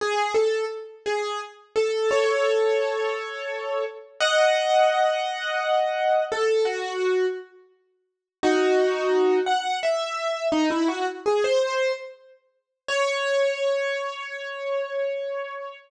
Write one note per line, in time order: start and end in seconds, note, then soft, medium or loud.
0.01 0.32 G#4 medium
0.35 0.65 A4 medium
1.06 1.40 G#4 medium
1.76 2.09 A4 medium
2.11 3.84 A4 medium
2.11 3.84 C#5 medium
4.20 6.24 D#5 medium
4.20 6.24 F#5 loud
6.32 6.66 A4 medium
6.65 7.26 F#4 medium
8.43 9.39 D#4 medium
8.43 9.39 F#4 loud
9.46 9.79 F#5 medium
9.83 10.47 E5 medium
10.52 10.69 D#4 loud
10.70 10.88 E4 medium
10.88 11.06 F#4 medium
11.26 11.44 G#4 medium
11.44 11.92 C5 medium
12.88 15.77 C#5 loud